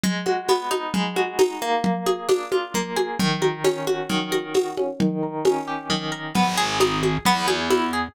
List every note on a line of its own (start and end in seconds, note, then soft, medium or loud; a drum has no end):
0.03 0.94 G#3 medium
0.03 low conga loud
0.26 1.16 F#4 medium
0.26 high conga medium
0.48 1.78 B3 medium
0.48 tambourine medium
0.48 high conga medium
0.71 1.38 D#4 medium
0.71 high conga medium
0.94 1.80 G#3 medium
0.94 low conga loud
1.16 1.81 F#4 medium
1.16 high conga medium
1.39 1.82 D#4 medium
1.39 tambourine loud
1.39 high conga loud
1.62 2.74 A#3 medium
1.84 low conga loud
2.06 2.96 G#4 medium
2.06 high conga medium
2.29 3.14 D4 medium
2.29 tambourine medium
2.29 high conga loud
2.52 3.16 F4 medium
2.52 high conga medium
2.74 3.18 A#3 medium
2.74 low conga medium
2.96 3.18 G#4 medium
2.96 high conga medium
3.19 4.09 D#3 medium
3.19 low conga loud
3.42 4.31 A#4 medium
3.42 high conga medium
3.64 4.77 C#4 medium
3.64 tambourine medium
3.64 high conga medium
3.87 4.54 F#4 medium
3.87 high conga medium
4.09 4.95 D#3 medium
4.09 low conga medium
4.32 4.96 A#4 medium
4.32 high conga medium
4.54 4.98 F#4 medium
4.54 tambourine medium
4.54 high conga medium
4.77 4.99 C#4 medium
4.77 high conga medium
5.00 5.89 D#3 medium
5.00 low conga loud
5.23 6.11 A#4 medium
5.45 6.31 C#4 medium
5.45 tambourine medium
5.45 high conga loud
5.68 6.32 G4 medium
5.90 6.33 D#3 medium
5.90 low conga medium
6.12 6.33 A#4 medium
6.35 7.18 G#1 medium
6.35 6.55 B3 medium
6.35 low conga loud
6.57 6.78 G#4 medium
6.80 7.01 D#4 medium
6.80 tambourine medium
6.80 high conga medium
7.03 7.24 G#4 medium
7.03 high conga medium
7.25 8.08 E2 medium
7.25 7.47 B3 loud
7.25 low conga loud
7.48 7.68 G#4 medium
7.48 high conga medium
7.70 7.91 E4 medium
7.70 tambourine medium
7.70 high conga medium
7.93 8.13 G#4 medium